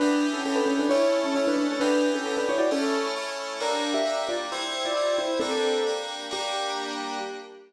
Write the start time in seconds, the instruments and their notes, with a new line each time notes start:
0.00 electric piano 2 E3 B3 G4, acoustic grand piano D4 B4
0.33 acoustic grand piano C#4 A4
0.45 electric piano 2 E3 B3 G4, acoustic grand piano C#4 A4
0.56 acoustic grand piano D4 B4
0.66 acoustic grand piano C#4 A4
0.79 acoustic grand piano D4 B4
0.89 electric piano 2 A3 C#4 E4, acoustic grand piano E4 C#5
1.24 acoustic grand piano C#4 A4
1.35 electric piano 2 A3 C#4 E4, acoustic grand piano E4 C#5
1.47 acoustic grand piano D4 B4
1.57 acoustic grand piano D4 B4
1.70 acoustic grand piano C#4 A4
1.80 electric piano 2 E3 B3 G4, acoustic grand piano D4 B4
2.14 acoustic grand piano C#4 A4
2.25 electric piano 2 E3 B3 G4, acoustic grand piano C#4 A4
2.37 acoustic grand piano D4 B4
2.49 acoustic grand piano E4 C#5
2.58 acoustic grand piano F#4 D5
2.71 electric piano 2 A3 C#4 E4, acoustic grand piano C#4 A4
3.16 electric piano 2 A3 C#4 E4
3.60 electric piano 2 G3 A#3 D4, acoustic grand piano D4 A#4
3.94 acoustic grand piano G4 E5
4.05 electric piano 2 G3 A#3 D4
4.29 acoustic grand piano F4 D5
4.52 electric piano 2 G3 C4 E4, acoustic grand piano E4 C5
4.85 acoustic grand piano F4 D5
4.96 electric piano 2 G3 C4 E4
5.18 acoustic grand piano E4 C5
5.40 electric piano 2 G3 A#3 D4, acoustic grand piano C4 A4
5.86 electric piano 2 G3 A#3 D4
6.31 electric piano 2 G3 A#3 D4, acoustic grand piano G4